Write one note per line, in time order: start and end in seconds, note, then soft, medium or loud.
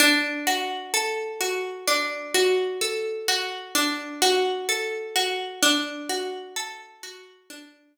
0.00 1.87 D4 loud
0.47 1.40 F#4 medium
0.94 2.81 A4 medium
1.41 2.34 F#4 medium
1.88 3.74 D4 medium
2.34 3.28 F#4 medium
2.81 4.68 A4 medium
3.28 4.21 F#4 medium
3.75 5.53 D4 medium
4.22 5.15 F#4 medium
4.69 5.58 A4 medium
5.16 5.60 F#4 medium
5.62 7.49 D4 medium
6.09 7.03 F#4 medium
6.56 7.97 A4 medium
7.03 7.96 F#4 medium
7.50 7.97 D4 medium
7.97 7.97 F#4 medium